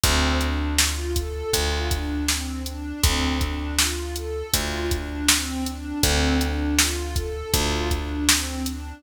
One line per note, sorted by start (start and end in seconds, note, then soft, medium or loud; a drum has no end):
0.04 1.43 D2 medium
0.04 0.38 C4 loud
0.04 kick loud
0.04 closed hi-hat loud
0.41 0.76 D4 medium
0.41 closed hi-hat medium
0.78 1.12 F4 medium
0.78 snare loud
1.15 1.49 A4 medium
1.15 kick medium
1.15 closed hi-hat loud
1.53 2.93 D2 medium
1.53 1.89 F4 medium
1.53 kick loud
1.53 closed hi-hat loud
1.91 2.25 D4 medium
1.91 kick loud
1.91 closed hi-hat loud
2.28 2.63 C4 medium
2.28 snare loud
2.66 3.01 D4 medium
2.66 closed hi-hat medium
3.03 4.43 D2 medium
3.03 3.39 C4 loud
3.03 kick loud
3.03 closed hi-hat loud
3.40 3.74 D4 medium
3.40 kick loud
3.40 closed hi-hat medium
3.79 4.13 F4 medium
3.79 snare loud
4.16 4.51 A4 medium
4.16 closed hi-hat medium
4.54 5.93 D2 medium
4.54 4.88 F4 medium
4.54 kick loud
4.54 closed hi-hat loud
4.91 5.26 D4 medium
4.91 kick loud
4.91 closed hi-hat medium
5.28 5.64 C4 loud
5.28 snare loud
5.66 6.00 D4 medium
5.66 closed hi-hat medium
6.03 7.43 D2 medium
6.03 6.38 C4 loud
6.03 kick loud
6.03 closed hi-hat loud
6.40 6.75 D4 medium
6.40 closed hi-hat medium
6.79 7.15 F4 medium
6.79 snare loud
7.16 7.50 A4 loud
7.16 kick loud
7.16 closed hi-hat medium
7.54 8.93 D2 medium
7.54 7.88 F4 loud
7.54 kick loud
7.54 closed hi-hat loud
7.90 8.24 D4 medium
7.90 kick loud
7.90 closed hi-hat medium
8.29 8.63 C4 medium
8.29 snare loud
8.66 9.01 D4 medium
8.66 closed hi-hat medium